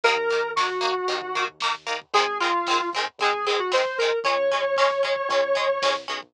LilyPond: <<
  \new Staff \with { instrumentName = "Lead 1 (square)" } { \time 4/4 \key bes \minor \tempo 4 = 114 bes'4 ges'2 r4 | aes'8 f'4 r8 aes'8 aes'16 ges'16 c''8 bes'8 | des''2.~ des''8 r8 | }
  \new Staff \with { instrumentName = "Acoustic Guitar (steel)" } { \time 4/4 \key bes \minor <ees bes>8 <ees bes>8 <ees bes>8 <ees bes>8 <ees bes>8 <ees bes>8 <ees bes>8 <ees bes>8 | <ees aes c'>8 <ees aes c'>8 <ees aes c'>8 <ees aes c'>8 <ees aes c'>8 <ees aes c'>8 <ees aes c'>8 <ees aes c'>8 | <aes des'>8 <aes des'>8 <aes des'>8 <aes des'>8 <aes des'>8 <aes des'>8 <aes des'>8 <aes des'>8 | }
  \new Staff \with { instrumentName = "Synth Bass 1" } { \clef bass \time 4/4 \key bes \minor ees,2 ees,2 | aes,,2 aes,,2 | des,2 des,4 c,8 b,,8 | }
  \new DrumStaff \with { instrumentName = "Drums" } \drummode { \time 4/4 <hh bd>16 bd16 <hh bd>16 bd16 <bd sn>16 bd16 <hh bd>16 bd16 <hh bd>16 bd16 <hh bd>16 bd16 <bd sn>16 bd16 <hh bd>16 bd16 | <hh bd>16 bd16 <hh bd>16 bd16 <bd sn>16 bd16 <hh bd>16 bd16 <hh bd>16 bd16 <hh bd>16 bd16 <bd sn>16 bd16 <hh bd>16 bd16 | <hh bd>16 bd16 <hh bd>16 bd16 <bd sn>16 bd16 <hh bd>16 bd16 <hh bd>16 bd16 <hh bd>16 bd16 <bd sn>16 bd16 <hh bd>16 bd16 | }
>>